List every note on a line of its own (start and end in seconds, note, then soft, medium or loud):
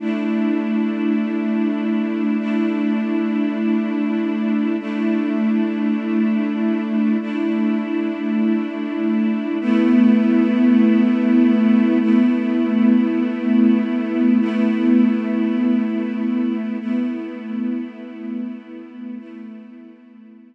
0.00 2.37 A3 medium
0.00 2.37 D4 medium
0.00 2.37 E4 medium
2.39 4.76 A3 medium
2.39 4.76 D4 medium
2.39 4.76 E4 medium
4.80 7.17 A3 medium
4.80 7.17 D4 medium
4.80 7.17 E4 medium
7.21 9.58 A3 medium
7.21 9.58 D4 medium
7.21 9.58 E4 medium
9.61 11.98 A3 medium
9.61 11.98 B3 medium
9.61 11.98 E4 medium
12.00 14.38 A3 medium
12.00 14.38 B3 medium
12.00 14.38 E4 medium
14.40 16.78 A3 medium
14.40 16.78 B3 medium
14.40 16.78 E4 medium
16.80 19.18 A3 medium
16.80 19.18 B3 medium
16.80 19.18 E4 medium
19.18 20.55 A3 medium
19.18 20.55 B3 medium
19.18 20.55 E4 medium